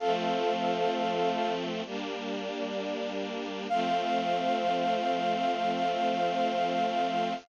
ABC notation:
X:1
M:4/4
L:1/8
Q:1/4=65
K:F
V:1 name="Brass Section"
[Af]4 z4 | f8 |]
V:2 name="String Ensemble 1"
[F,A,C]4 [G,B,D]4 | [F,A,C]8 |]